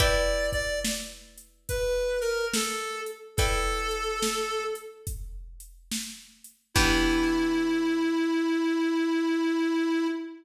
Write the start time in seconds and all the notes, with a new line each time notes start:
0.00 E4 B4 D5 G5, kick, closed hi-hat
0.52 D5, kick, closed hi-hat
0.85 snare
1.38 closed hi-hat
1.69 B4, kick, closed hi-hat
2.21 A#4, closed hi-hat
2.54 A4, snare
3.06 closed hi-hat
3.37 E4 A4 B4 D5 G5, kick, closed hi-hat
3.91 closed hi-hat
4.22 snare
4.75 closed hi-hat
5.07 kick, closed hi-hat
5.60 closed hi-hat
5.92 snare
6.44 closed hi-hat
6.74 E3 B3 D4 E4 G4, kick, crash